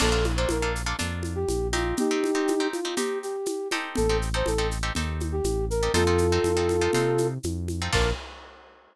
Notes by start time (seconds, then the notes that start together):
0.00 A#1 A#3 D4 F4 A4, crash, low conga, shaker
0.12 A#3 D4 F4 A4
0.24 high conga, shaker
0.37 A#3 D4 F4 A4 C5
0.49 A#1 A#4, high conga, shaker
0.62 A#3 D4 F4 A4
0.76 shaker
0.86 A#3 D4 F4 A4
0.99 F2 A#3 D4 F4 A4, low conga, shaker
1.23 high conga, shaker
1.35 G4
1.48 A#1, high conga, shaker
1.73 C4 D#4 F4 G4, high conga, shaker
1.97 D#4 G4, low conga, shaker
2.11 C4 D#4 G4
2.24 high conga, shaker
2.35 C4 D#4 G4
2.48 high conga, shaker
2.60 C4 D#4 G4
2.73 F4, high conga, shaker
2.85 C4 D#4 G4
2.97 C4 D#4 G4, low conga, shaker
3.23 G4, shaker
3.46 high conga, shaker
3.71 C4 D#4 G4 A4, high conga, shaker
3.96 A1 A4, low conga, shaker
4.09 C4 D#4 G4 A4
4.22 shaker
4.34 C4 D#4 G4 A4 C5
4.46 A1 A4, high conga, shaker
4.58 C4 D#4 G4 A4
4.71 shaker
4.83 C4 D#4 G4 A4
4.95 D#2 C4 D#4 G4 A4, low conga, shaker
5.20 high conga, shaker
5.32 G4
5.44 A1, high conga, shaker
5.70 A#4, shaker
5.83 C4 D#4 G4 A4
5.94 F2 C4 D#4 F4 A4, low conga, shaker
6.07 C4 D#4 F4 A4
6.18 high conga, shaker
6.32 C4 D#4 F4 A4
6.44 F2, high conga, shaker
6.57 C4 D#4 F4 A4
6.69 high conga, shaker
6.81 C4 D#4 F4 A4
6.93 C3 C4 D#4 F4 A4, low conga, shaker
7.18 high conga, shaker
7.43 F2, high conga, shaker
7.68 high conga, shaker
7.82 C4 D#4 F4 A4
7.93 A#1 A#3 D4 F4 A4 A#4, kick, crash